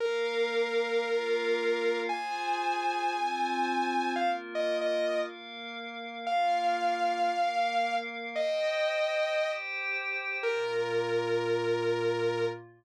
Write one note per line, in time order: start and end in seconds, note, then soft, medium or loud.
0.00 1.03 A#3 medium
0.00 1.03 A#4 medium
0.00 1.98 A#4 loud
0.00 1.03 F5 loud
1.05 2.08 A#3 medium
1.05 2.08 F4 medium
1.05 2.08 F5 medium
2.09 3.12 F4 medium
2.09 3.12 G#4 medium
2.09 3.12 C5 loud
2.09 4.10 G#5 loud
3.13 4.16 C4 medium
3.13 4.16 F4 loud
3.13 4.16 C5 medium
4.16 5.21 A#3 medium
4.16 5.21 F4 medium
4.16 5.21 A#4 medium
4.16 4.28 F5 loud
4.55 4.77 D#5 medium
4.81 5.19 D#5 loud
5.22 6.25 A#3 medium
5.22 6.25 A#4 medium
5.22 6.25 F5 medium
6.26 7.29 A#3 medium
6.26 7.29 F4 medium
6.26 7.29 A#4 medium
6.26 7.94 F5 loud
7.30 8.34 A#3 medium
7.30 8.34 A#4 medium
7.30 8.34 F5 medium
8.35 9.38 C5 medium
8.35 9.38 D#5 medium
8.35 9.50 D#5 loud
8.35 9.38 G5 loud
9.39 10.42 G4 medium
9.39 10.42 C5 medium
9.39 10.42 G5 medium
10.43 12.45 A#2 loud
10.43 12.45 A#3 medium
10.43 12.45 F4 medium
10.43 12.45 A#4 loud